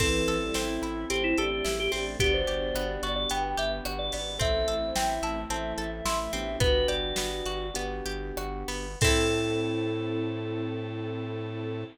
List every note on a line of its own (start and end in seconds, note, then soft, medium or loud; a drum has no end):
0.00 0.24 A1 loud
0.00 0.38 E3 loud
0.00 0.54 C4 medium
0.00 1.08 C4 medium
0.00 1.99 C4 medium
0.00 1.08 E4 medium
0.00 1.99 E4 medium
0.00 0.74 A4 medium
0.00 1.08 A4 medium
0.00 1.99 A4 medium
0.00 kick medium
0.00 crash medium
0.28 0.51 A1 loud
0.28 1.38 A4 medium
0.28 closed hi-hat medium
0.42 0.55 G3 loud
0.54 0.79 A1 loud
0.54 1.10 C4 medium
0.54 1.05 E4 loud
0.54 snare medium
0.82 1.05 A1 medium
0.82 1.64 E4 medium
0.82 closed hi-hat medium
1.10 1.34 A1 medium
1.10 2.19 A3 medium
1.10 1.91 C4 medium
1.10 2.19 C4 medium
1.10 1.36 C4 loud
1.10 1.23 G4 medium
1.10 2.19 A4 medium
1.10 closed hi-hat medium
1.24 1.37 E4 loud
1.37 1.61 A1 medium
1.37 1.50 D4 loud
1.37 1.73 G4 medium
1.37 2.17 A4 medium
1.37 closed hi-hat medium
1.52 1.65 D4 loud
1.64 1.88 A1 loud
1.64 2.17 E4 medium
1.64 1.78 G4 loud
1.64 snare medium
1.79 1.92 G4 loud
1.79 1.91 G4 medium
1.92 2.16 A1 medium
1.92 2.18 C4 medium
1.92 2.17 D4 loud
1.92 2.05 G4 medium
1.92 open hi-hat medium
2.19 2.44 G1 loud
2.19 4.18 B3 medium
2.19 2.75 B3 medium
2.19 3.29 B3 medium
2.19 3.13 D4 loud
2.19 4.18 D4 medium
2.19 3.29 D4 medium
2.19 4.18 F#4 medium
2.19 3.29 F#4 medium
2.19 2.33 G4 loud
2.19 4.18 G4 medium
2.19 3.29 G4 medium
2.19 kick medium
2.19 closed hi-hat loud
2.34 2.88 C5 medium
2.47 2.72 G1 loud
2.47 3.57 G4 medium
2.47 closed hi-hat medium
2.74 2.98 G1 loud
2.74 3.30 B3 medium
2.74 cross-stick loud
3.03 3.26 G1 loud
3.03 3.85 F#4 medium
3.03 3.15 D5 medium
3.03 closed hi-hat medium
3.16 3.29 D5 medium
3.29 3.55 G1 medium
3.29 4.39 B3 medium
3.29 4.12 B3 medium
3.29 4.39 D4 medium
3.29 4.39 G4 medium
3.29 4.39 B4 medium
3.29 3.43 G5 medium
3.29 closed hi-hat medium
3.44 3.57 G5 medium
3.57 3.81 G1 loud
3.57 4.36 G4 medium
3.57 3.71 E5 medium
3.57 closed hi-hat medium
3.85 4.10 G1 loud
3.85 4.38 F#4 medium
3.85 cross-stick medium
3.99 4.12 D5 medium
4.12 4.38 G#1 medium
4.12 4.39 B3 medium
4.12 4.37 D5 medium
4.12 open hi-hat medium
4.39 4.64 A1 loud
4.39 5.49 A3 medium
4.39 5.38 C4 medium
4.39 4.95 C4 medium
4.39 5.49 C4 medium
4.39 5.38 E4 medium
4.39 5.49 E4 medium
4.39 5.38 A4 loud
4.39 4.75 A4 loud
4.39 4.90 E5 medium
4.39 kick medium
4.39 closed hi-hat medium
4.68 4.91 A1 medium
4.68 5.78 A4 medium
4.68 closed hi-hat medium
4.83 4.96 C5 loud
4.95 5.19 A1 medium
4.95 5.50 C4 medium
4.95 5.41 E5 loud
4.95 5.09 G5 medium
4.95 snare loud
5.22 5.45 A1 loud
5.22 6.05 E4 medium
5.22 5.36 A5 medium
5.22 closed hi-hat medium
5.49 5.73 A1 loud
5.49 6.59 E3 medium
5.49 6.59 A3 medium
5.49 6.32 C4 medium
5.49 6.29 C4 medium
5.49 6.59 E4 medium
5.49 6.29 E4 medium
5.49 6.29 A4 medium
5.49 5.73 E5 loud
5.49 5.73 A5 medium
5.49 closed hi-hat medium
5.77 6.01 A1 loud
5.77 6.56 A4 medium
5.77 5.90 E5 loud
5.77 closed hi-hat medium
5.93 6.05 E5 loud
6.05 6.29 A1 loud
6.05 6.58 E4 medium
6.05 6.19 E5 loud
6.05 6.18 C6 medium
6.05 snare loud
6.19 6.32 E5 loud
6.32 6.57 A1 loud
6.32 7.64 B3 medium
6.32 6.59 C4 medium
6.32 7.64 D4 medium
6.32 7.64 F#4 medium
6.32 7.64 G4 medium
6.32 6.56 E5 loud
6.32 closed hi-hat medium
6.60 6.84 G1 loud
6.60 7.17 B3 medium
6.60 7.66 F#4 loud
6.60 6.86 B4 medium
6.60 kick loud
6.60 closed hi-hat medium
6.88 7.12 G1 loud
6.88 8.05 G4 medium
6.88 7.84 D5 medium
6.88 closed hi-hat medium
7.16 7.42 G1 medium
7.16 7.75 B3 medium
7.16 snare loud
7.46 7.71 G1 loud
7.46 8.37 F#4 medium
7.46 closed hi-hat medium
7.74 8.01 G1 loud
7.74 8.87 B3 medium
7.74 8.68 B3 medium
7.74 8.87 D4 medium
7.74 8.87 F#4 medium
7.74 8.87 G4 medium
7.74 closed hi-hat loud
8.06 8.32 G1 loud
8.06 8.96 G4 medium
8.06 closed hi-hat medium
8.37 8.64 G1 loud
8.37 8.99 F#4 medium
8.37 cross-stick loud
8.68 8.96 G1 medium
8.68 8.99 B3 medium
8.68 open hi-hat medium
9.01 11.84 A2 loud
9.01 11.84 C4 loud
9.01 11.84 C4 medium
9.01 11.84 E4 loud
9.01 11.84 A4 medium
9.01 11.84 A4 loud
9.01 11.85 A4 loud
9.01 kick loud
9.01 crash loud
9.07 11.84 A4 medium